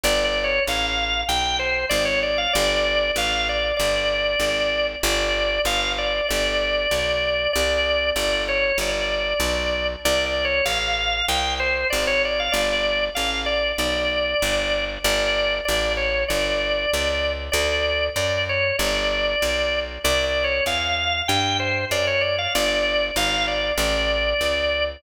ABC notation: X:1
M:4/4
L:1/16
Q:1/4=96
K:G
V:1 name="Drawbar Organ"
(3d2 d2 ^c2 =f4 g2 =c2 d ^c d f | d4 =f2 d2 d8 | d4 =f2 d2 d8 | d4 d2 ^c2 d8 |
(3d2 d2 ^c2 =f4 g2 =c2 d ^c d f | d4 =f2 d2 d8 | d4 d2 ^c2 d8 | d4 d2 ^c2 d8 |
(3d2 d2 ^c2 =f4 g2 =c2 d ^c d f | d4 =f2 d2 d8 |]
V:2 name="Electric Bass (finger)" clef=bass
G,,,4 A,,,4 B,,,4 ^G,,,4 | G,,,4 A,,,4 G,,,4 ^G,,,4 | G,,,4 G,,,4 G,,,4 B,,,4 | C,,4 G,,,4 G,,,4 B,,,4 |
C,,4 A,,,4 C,,4 ^G,,,4 | G,,,4 A,,,4 B,,,4 G,,,4 | G,,,4 A,,,4 G,,,4 ^C,,4 | D,,4 F,,4 G,,,4 B,,,4 |
C,,4 E,,4 G,,4 F,,4 | G,,,4 ^G,,,4 A,,,4 ^C,,4 |]